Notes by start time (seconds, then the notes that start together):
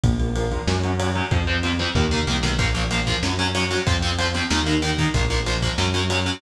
0.04 A#1 F3 A#3, kick, ride
0.20 F3 A#3, ride
0.36 F3 A#3, ride
0.52 F3 A#3, kick, ride
0.67 F#2 F#3 C#4, snare
0.84 F#3 C#4, ride
0.99 F#3 C#4, ride
1.15 F#3 C#4, ride
1.31 F2 F3 C4, kick, ride
1.47 F3 C4, ride
1.63 F3 C4, ride
1.79 F3 C4, ride
1.95 D#2 D#3 A#3, kick, floor tom
2.11 D#3 A#3, mid tom
2.27 C2 D#3 A#3, high tom
2.43 B1 D#3 A#3, snare
2.59 A#1 F3 A#3, kick, ride
2.75 F3 A#3, ride
2.91 F3 A#3, ride
3.07 F3 A#3, kick, ride
3.23 F#2 F#3 C#4, snare
3.39 F#3 C#4, ride
3.55 F#3 C#4, ride
3.71 F#3 C#4, ride
3.87 F2 F3 C4, kick, ride
4.02 F3 C4, ride
4.18 F3 C4, ride
4.34 F3 C4, ride
4.50 D#2 D#3 A#3, snare
4.66 D#3 A#3, ride
4.82 D#3 A#3, ride
4.98 D#3 A#3, kick, ride
5.14 A#1 F3 A#3, kick, ride
5.30 F3 A#3, ride
5.46 F3 A#3, ride
5.62 F3 A#3, kick, ride
5.78 F#2 F#3 C#4, snare
5.94 F#3 C#4, ride
6.10 F#3 C#4, ride
6.26 F#3 C#4, ride